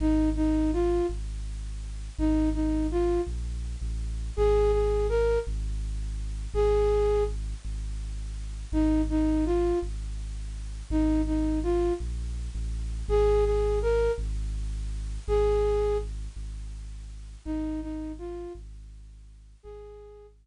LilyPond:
<<
  \new Staff \with { instrumentName = "Flute" } { \time 6/8 \key aes \mixolydian \tempo 4. = 55 ees'8 ees'8 f'8 r4. | ees'8 ees'8 f'8 r4. | aes'8 aes'8 bes'8 r4. | aes'4 r2 |
ees'8 ees'8 f'8 r4. | ees'8 ees'8 f'8 r4. | aes'8 aes'8 bes'8 r4. | aes'4 r2 |
ees'8 ees'8 f'8 r4. | aes'4 r2 | }
  \new Staff \with { instrumentName = "Synth Bass 2" } { \clef bass \time 6/8 \key aes \mixolydian aes,,4. aes,,4. | aes,,4. bes,,8. a,,8. | aes,,4. aes,,4. | aes,,4. aes,,4. |
aes,,4. aes,,4. | aes,,4. bes,,8. a,,8. | aes,,4. aes,,4. | aes,,4. aes,,4. |
aes,,4. aes,,4. | aes,,4. r4. | }
>>